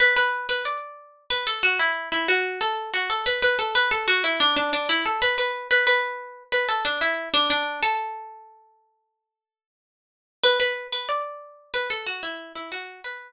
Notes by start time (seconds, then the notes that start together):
0.00 B4
0.16 B4
0.49 B4
0.65 D5
1.30 B4
1.47 A4
1.63 F#4
1.79 E4
2.12 E4
2.28 F#4
2.61 A4
2.94 F#4
3.10 A4
3.26 B4
3.42 B4
3.59 A4
3.75 B4
3.91 A4
4.08 F#4
4.24 E4
4.40 D4
4.57 D4
4.73 D4
4.89 E4
5.06 A4
5.22 B4
5.38 B4
5.71 B4
5.87 B4
6.52 B4
6.69 A4
6.85 D4
7.01 E4
7.34 D4
7.50 D4
7.83 A4
10.43 B4
10.60 B4
10.92 B4
11.09 D5
11.74 B4
11.90 A4
12.07 F#4
12.23 E4
12.55 E4
12.72 F#4
13.04 B4